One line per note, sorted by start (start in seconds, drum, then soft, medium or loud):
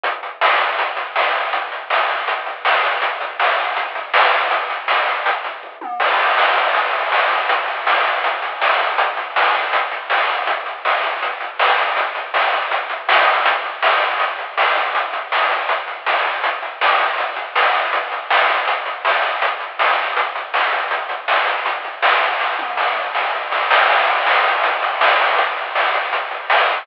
0.03 kick loud
0.03 closed hi-hat loud
0.23 closed hi-hat medium
0.41 snare loud
0.60 kick medium
0.60 closed hi-hat medium
0.78 kick medium
0.78 closed hi-hat loud
0.97 kick medium
0.97 closed hi-hat medium
1.16 snare loud
1.34 closed hi-hat medium
1.53 kick loud
1.53 closed hi-hat medium
1.72 closed hi-hat medium
1.90 snare loud
2.09 kick medium
2.09 closed hi-hat medium
2.28 kick medium
2.28 closed hi-hat loud
2.46 kick medium
2.46 closed hi-hat medium
2.65 snare loud
2.83 kick medium
2.83 closed hi-hat medium
3.02 kick loud
3.02 closed hi-hat loud
3.20 kick medium
3.20 closed hi-hat medium
3.40 snare loud
3.58 kick medium
3.58 closed hi-hat medium
3.76 kick medium
3.76 closed hi-hat medium
3.95 kick medium
3.95 closed hi-hat medium
4.14 snare loud
4.33 closed hi-hat medium
4.51 kick loud
4.51 closed hi-hat medium
4.70 closed hi-hat medium
4.88 snare loud
5.07 closed hi-hat medium
5.25 kick medium
5.25 closed hi-hat loud
5.44 kick medium
5.44 closed hi-hat medium
5.63 kick medium
5.81 high tom medium
6.00 kick loud
6.00 crash loud
6.19 closed hi-hat medium
6.38 snare loud
6.56 kick medium
6.56 closed hi-hat medium
6.75 kick medium
6.75 closed hi-hat medium
6.93 kick medium
6.93 closed hi-hat medium
7.12 snare loud
7.30 closed hi-hat medium
7.49 kick medium
7.49 closed hi-hat loud
7.68 closed hi-hat medium
7.87 snare loud
8.05 kick medium
8.05 closed hi-hat medium
8.24 kick medium
8.24 closed hi-hat loud
8.42 kick medium
8.42 closed hi-hat medium
8.61 snare loud
8.80 kick medium
8.80 closed hi-hat medium
8.98 kick loud
8.98 closed hi-hat loud
9.17 kick medium
9.17 closed hi-hat medium
9.36 snare loud
9.54 kick medium
9.54 closed hi-hat medium
9.73 kick medium
9.73 closed hi-hat loud
9.92 kick medium
9.92 closed hi-hat medium
10.10 snare loud
10.29 closed hi-hat medium
10.47 kick loud
10.47 closed hi-hat loud
10.66 closed hi-hat medium
10.85 snare loud
11.03 kick medium
11.03 closed hi-hat medium
11.22 kick medium
11.22 closed hi-hat medium
11.41 kick medium
11.41 closed hi-hat medium
11.59 snare loud
11.78 kick medium
11.78 closed hi-hat medium
11.97 kick loud
11.97 closed hi-hat loud
12.15 closed hi-hat medium
12.34 snare loud
12.52 kick medium
12.52 closed hi-hat medium
12.71 kick medium
12.71 closed hi-hat loud
12.90 kick medium
12.90 closed hi-hat medium
13.09 snare loud
13.27 closed hi-hat medium
13.46 kick loud
13.46 closed hi-hat loud
13.64 closed hi-hat medium
13.83 snare loud
14.02 kick medium
14.02 closed hi-hat medium
14.20 kick medium
14.20 closed hi-hat medium
14.39 kick medium
14.39 closed hi-hat medium
14.58 snare loud
14.76 kick medium
14.76 closed hi-hat medium
14.95 kick loud
14.95 closed hi-hat loud
15.13 kick medium
15.13 closed hi-hat medium
15.32 snare loud
15.50 kick medium
15.50 closed hi-hat medium
15.69 kick medium
15.69 closed hi-hat loud
15.88 kick medium
15.88 closed hi-hat medium
16.06 snare loud
16.25 closed hi-hat medium
16.44 kick loud
16.44 closed hi-hat loud
16.63 closed hi-hat medium
16.81 snare loud
16.99 kick medium
16.99 closed hi-hat medium
17.18 kick medium
17.18 closed hi-hat medium
17.36 kick medium
17.36 closed hi-hat medium
17.56 snare loud
17.74 kick medium
17.74 closed hi-hat medium
17.93 kick loud
17.93 closed hi-hat medium
18.12 closed hi-hat medium
18.30 snare loud
18.49 kick medium
18.49 closed hi-hat medium
18.67 kick medium
18.67 closed hi-hat loud
18.86 kick medium
18.86 closed hi-hat medium
19.05 snare loud
19.23 closed hi-hat medium
19.42 kick loud
19.42 closed hi-hat loud
19.60 closed hi-hat medium
19.79 snare loud
19.98 closed hi-hat medium
20.17 kick medium
20.17 closed hi-hat loud
20.35 kick medium
20.35 closed hi-hat medium
20.54 snare loud
20.72 kick medium
20.72 closed hi-hat medium
20.91 kick loud
20.91 closed hi-hat medium
21.09 kick medium
21.09 closed hi-hat medium
21.28 snare loud
21.47 kick medium
21.47 closed hi-hat medium
21.66 kick medium
21.66 closed hi-hat medium
21.84 kick medium
21.84 closed hi-hat medium
22.02 snare loud
22.21 closed hi-hat medium
22.40 kick medium
22.40 snare medium
22.59 high tom medium
22.77 snare medium
22.96 mid tom medium
23.15 snare medium
23.34 floor tom medium
23.52 snare medium
23.71 snare loud
23.89 kick medium
23.89 crash loud
24.07 closed hi-hat medium
24.26 snare loud
24.45 kick medium
24.45 closed hi-hat medium
24.64 kick medium
24.64 closed hi-hat loud
24.82 kick medium
24.82 closed hi-hat medium
25.01 snare loud
25.19 open hi-hat medium
25.38 kick loud
25.38 closed hi-hat loud
25.57 closed hi-hat medium
25.75 snare loud
25.94 kick medium
25.94 closed hi-hat medium
26.13 kick medium
26.13 closed hi-hat loud
26.31 kick medium
26.31 closed hi-hat medium
26.50 snare loud
26.68 kick medium
26.68 closed hi-hat medium